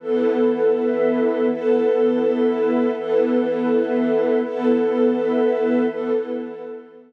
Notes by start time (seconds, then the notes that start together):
0.00 E3 B3 E4 A4 B4
0.74 E4 B4 E5
1.46 E3 B3 E4 A4 B4
2.19 E4 B4 E5
2.93 E3 B3 E4 A4 B4
3.66 E4 B4 E5
4.39 E3 B3 E4 A4 B4
5.11 E4 B4 E5
5.85 E3 B3 E4 A4 B4